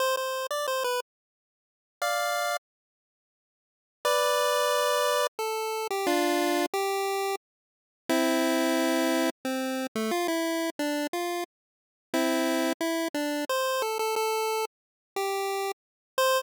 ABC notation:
X:1
M:3/4
L:1/16
Q:1/4=89
K:C
V:1 name="Lead 1 (square)"
c c2 d c B z6 | [df]4 z8 | [Bd]8 A3 G | [DF]4 G4 z4 |
[CE]8 C3 A, | F E3 D2 F2 z4 | [CE]4 E2 D2 c2 A A | A3 z3 G4 z2 |
c4 z8 |]